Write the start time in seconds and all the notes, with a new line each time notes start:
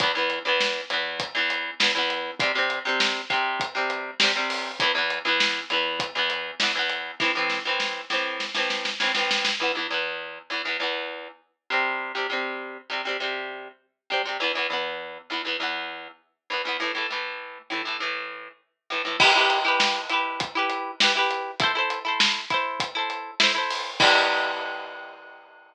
0.00 E2 E3 B3, kick, closed hi-hat
0.15 E2 E3 B3
0.30 closed hi-hat
0.45 E2 E3 B3
0.60 snare
0.90 E2 E3 B3, closed hi-hat
1.20 kick, closed hi-hat
1.35 E2 E3 B3
1.50 closed hi-hat
1.80 E2 E3 B3, snare
1.95 E2 E3 B3
2.10 closed hi-hat
2.40 C3 G3 C4, kick, closed hi-hat
2.55 C3 G3 C4
2.70 closed hi-hat
2.85 C3 G3 C4
3.00 snare
3.30 C3 G3 C4, kick, closed hi-hat
3.60 kick, closed hi-hat
3.75 C3 G3 C4
3.90 closed hi-hat
4.20 C3 G3 C4, snare
4.35 C3 G3 C4
4.50 open hi-hat
4.80 E2 E3 B3, kick, closed hi-hat
4.95 E2 E3 B3
5.10 closed hi-hat
5.25 E2 E3 B3
5.40 snare
5.70 E2 E3 B3, closed hi-hat
6.00 kick, closed hi-hat
6.15 E2 E3 B3
6.30 closed hi-hat
6.60 E2 E3 B3, snare
6.75 E2 E3 B3
6.90 closed hi-hat
7.20 A2 E3 C4, kick, snare
7.35 A2 E3 C4
7.50 snare
7.65 A2 E3 C4
7.80 snare
8.10 A2 E3 C4, snare
8.40 snare
8.54 A2 E3 C4, snare
8.70 snare
8.85 snare
9.00 A2 E3 C4, snare
9.15 A2 E3 C4, snare
9.31 snare
9.45 snare
9.60 E2 E3 B3
9.75 E2 E3 B3
9.90 E2 E3 B3
10.50 E2 E3 B3
10.65 E2 E3 B3
10.80 E2 E3 B3
11.70 C3 G3 C4
12.15 C3 G3 C4
12.30 C3 G3 C4
12.90 C3 G3 C4
13.05 C3 G3 C4
13.20 C3 G3 C4
14.10 C3 G3 C4
14.25 C3 G3 C4
14.40 E2 E3 B3
14.55 E2 E3 B3
14.70 E2 E3 B3
15.30 E2 E3 B3
15.45 E2 E3 B3
15.60 E2 E3 B3
16.50 E2 E3 B3
16.65 E2 E3 B3
16.80 A2 E3 A3
16.95 A2 E3 A3
17.10 A2 E3 A3
17.70 A2 E3 A3
17.85 A2 E3 A3
18.00 A2 E3 A3
18.90 A2 E3 A3
19.05 A2 E3 A3
19.20 E4 G4 B4, kick, crash
19.35 E4 G4 B4
19.50 closed hi-hat
19.65 E4 G4 B4
19.80 snare
20.09 E4 G4 B4, closed hi-hat
20.40 kick, closed hi-hat
20.55 E4 G4 B4
20.70 closed hi-hat
21.00 E4 G4 B4, snare
21.15 E4 G4 B4
21.31 closed hi-hat
21.60 E4 A4 C5, kick, closed hi-hat
21.75 E4 A4 C5
21.90 closed hi-hat
22.05 E4 A4 C5
22.20 snare
22.50 E4 A4 C5, kick, closed hi-hat
22.80 kick, closed hi-hat
22.95 E4 A4 C5
23.10 closed hi-hat
23.40 E4 A4 C5, snare
23.55 E4 A4 C5
23.71 open hi-hat
24.00 E3 G3 B3, kick, crash